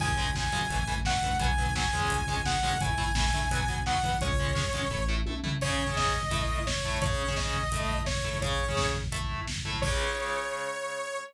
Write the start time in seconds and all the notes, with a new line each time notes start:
0.00 C#2 C#3 G#3 G#5, kick, crash
0.08 kick
0.17 C#3 G#3, kick, closed hi-hat
0.27 kick
0.35 C#3 G#3 G#5, kick, snare
0.44 kick
0.52 F#2 C#3 G#3, kick, closed hi-hat
0.61 kick
0.70 A1 E3 A3, kick, closed hi-hat
0.79 kick
0.87 E3 A3, kick, closed hi-hat
0.96 kick
1.05 E3 A3 F#5, kick, snare
1.14 kick
1.22 D2 E3 A3, kick, closed hi-hat
1.31 kick
1.39 B1 F#3 B3 G#5, kick, closed hi-hat
1.50 kick
1.58 F#3 B3, kick, closed hi-hat
1.66 kick
1.75 F#3 B3 G#5, kick, snare
1.84 kick
1.93 E2 G#3 C#4, kick, closed hi-hat
2.01 kick
2.10 C#2, kick, closed hi-hat
2.19 kick
2.28 G#3 C#4, kick, closed hi-hat
2.37 kick
2.46 G#3 C#4 F#5, kick, snare
2.55 kick
2.63 F#2 G#3 C#4, kick, open hi-hat
2.72 kick
2.81 A1 A3 E4 G#5, kick, closed hi-hat
2.89 kick
2.98 A3 E4, kick, closed hi-hat
3.07 kick
3.15 A3 E4 G#5, kick, snare
3.24 kick
3.33 D2 A3 E4, kick, closed hi-hat
3.42 kick
3.51 B1 F#3 B3, kick, closed hi-hat
3.59 kick
3.68 F#3 B3, kick, closed hi-hat
3.76 kick
3.86 F#3 B3 F#5, kick, snare
3.95 kick
4.03 E2 F#3 B3, kick, closed hi-hat
4.12 kick
4.21 C#2 G#3 C#4 C#5, kick, closed hi-hat
4.30 kick
4.39 G#3 C#4, kick, closed hi-hat
4.47 kick
4.55 G#3 C#4, kick, snare
4.64 kick
4.73 F#2 G#3 C#4, kick, closed hi-hat
4.82 kick
4.91 A1 A3 E4, kick
5.08 A3 E4
5.26 B1 A3 E4, high tom
5.43 C2 A3 E4, floor tom
5.61 C#3 C#4 G#4 C#5, kick, crash
5.70 kick
5.79 kick
5.87 C#3 C#4 G#4, kick
5.96 D#5, kick, snare
6.05 kick
6.14 kick
6.23 kick
6.31 A3 E4 A4, kick, closed hi-hat
6.40 kick
6.49 kick
6.58 kick
6.66 C#5, kick, snare
6.76 kick
6.85 A3 E4 A4, kick
6.94 kick
7.02 C#3 C#4 G#4 C#5, kick, closed hi-hat
7.11 kick
7.19 kick
7.28 C#3 C#4 G#4, kick
7.36 D#5, kick, snare
7.45 kick
7.54 kick
7.63 kick
7.72 A3 E4 A4, kick, closed hi-hat
7.81 kick
7.89 kick
7.98 kick
8.06 C#5, kick, snare
8.15 kick
8.24 A3 E4 A4, kick
8.33 kick
8.41 C#3 C#4 G#4 C#5, kick, closed hi-hat
8.51 kick
8.59 kick
8.68 C#3 C#4 G#4, kick
8.77 kick, snare
8.86 kick
8.95 kick
9.04 kick
9.12 A3 E4 A4, kick, closed hi-hat
9.21 kick
9.30 kick
9.38 kick
9.47 kick, snare
9.56 kick
9.65 A3 E4 A4, kick
9.74 kick
9.82 C#3 G#3 C#5, kick, crash